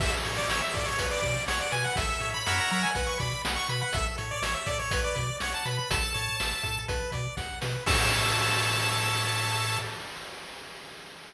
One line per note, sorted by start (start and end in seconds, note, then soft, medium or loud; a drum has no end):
0.00 0.13 A1 medium
0.00 0.23 A4 medium
0.00 0.12 E5 medium
0.00 kick medium
0.00 crash medium
0.23 0.39 A2 medium
0.23 0.47 C#5 medium
0.23 closed hi-hat medium
0.37 0.48 D5 medium
0.48 0.62 A1 medium
0.48 0.61 C#5 medium
0.48 0.71 E5 medium
0.48 snare medium
0.62 0.73 E5 medium
0.73 0.88 A2 medium
0.73 0.97 A4 medium
0.73 0.86 D5 medium
0.73 kick medium
0.73 closed hi-hat medium
0.86 1.06 C#5 medium
0.98 1.13 B1 medium
0.98 1.20 B4 medium
0.98 kick medium
0.98 closed hi-hat medium
1.11 1.43 D5 medium
1.22 1.37 B2 medium
1.22 1.44 D5 medium
1.22 kick medium
1.22 closed hi-hat soft
1.48 1.61 B1 medium
1.48 1.59 C#5 medium
1.48 1.70 F#5 medium
1.48 snare medium
1.60 1.72 D5 medium
1.72 1.86 B2 medium
1.72 1.94 B4 medium
1.72 1.84 G#5 medium
1.72 closed hi-hat medium
1.84 1.96 F#5 medium
1.96 2.10 A1 medium
1.96 2.19 A4 loud
1.96 2.30 E5 medium
1.96 kick medium
1.96 closed hi-hat medium
2.20 2.34 A2 medium
2.20 2.43 C#5 medium
2.20 closed hi-hat medium
2.34 2.56 B5 medium
2.46 2.60 F#2 medium
2.46 2.91 A#4 medium
2.46 2.91 C#5 loud
2.46 2.91 E5 medium
2.46 2.91 F#5 loud
2.46 snare medium
2.58 2.70 A#5 medium
2.70 2.85 F#3 medium
2.70 2.82 A#5 medium
2.70 closed hi-hat medium
2.83 2.94 G#5 medium
2.94 3.09 B1 medium
2.94 3.18 B4 loud
2.94 3.06 F#5 medium
2.94 kick medium
2.94 closed hi-hat medium
3.07 3.18 C#6 medium
3.19 3.33 B2 medium
3.19 3.42 D5 medium
3.19 3.42 B5 medium
3.19 kick medium
3.19 closed hi-hat medium
3.45 3.58 B1 medium
3.45 3.67 F#5 medium
3.45 snare loud
3.56 3.68 C#6 medium
3.69 3.82 B2 medium
3.69 3.92 B4 medium
3.69 3.81 B5 medium
3.69 closed hi-hat medium
3.81 3.93 F#5 medium
3.93 4.07 A1 medium
3.93 4.16 A4 loud
3.93 4.05 E5 medium
3.93 kick medium
3.93 closed hi-hat medium
4.18 4.32 A2 medium
4.18 4.40 C#5 medium
4.18 closed hi-hat medium
4.31 4.43 D5 medium
4.42 4.55 A1 medium
4.42 4.54 C#5 medium
4.42 4.65 E5 medium
4.42 snare medium
4.54 4.66 E5 medium
4.66 4.80 A2 medium
4.66 4.90 A4 medium
4.66 4.78 D5 medium
4.66 kick medium
4.66 closed hi-hat medium
4.79 5.01 C#5 medium
4.91 5.05 B1 medium
4.91 5.15 B4 loud
4.91 kick medium
4.91 closed hi-hat loud
5.04 5.36 D5 medium
5.16 5.30 B2 medium
5.16 5.39 D5 medium
5.16 kick medium
5.16 closed hi-hat medium
5.40 5.54 B1 medium
5.40 5.53 C#5 medium
5.40 5.64 F#5 medium
5.40 snare medium
5.54 5.66 A5 medium
5.65 5.79 B2 medium
5.65 5.88 B4 medium
5.65 5.77 B5 medium
5.65 closed hi-hat medium
5.78 5.90 B5 medium
5.90 6.04 A1 medium
5.90 6.12 A4 medium
5.90 6.79 A5 medium
5.90 kick medium
5.90 closed hi-hat loud
6.14 6.29 A2 medium
6.14 6.36 C#5 medium
6.14 closed hi-hat medium
6.40 6.54 A1 medium
6.40 6.62 E5 medium
6.40 snare medium
6.63 6.78 A2 medium
6.63 6.85 A4 medium
6.63 kick medium
6.63 closed hi-hat medium
6.88 7.02 B1 loud
6.88 7.10 B4 loud
6.88 kick medium
6.88 closed hi-hat medium
7.12 7.27 B2 medium
7.12 7.35 D5 medium
7.12 kick medium
7.12 closed hi-hat medium
7.37 7.51 B1 medium
7.37 7.59 F#5 medium
7.37 kick medium
7.37 snare medium
7.61 7.76 B2 medium
7.61 7.83 B4 medium
7.61 snare medium
7.86 9.78 A2 loud
7.86 9.78 A4 loud
7.86 9.78 C#5 loud
7.86 9.78 E5 loud
7.86 9.79 A5 loud
7.86 kick loud
7.86 crash loud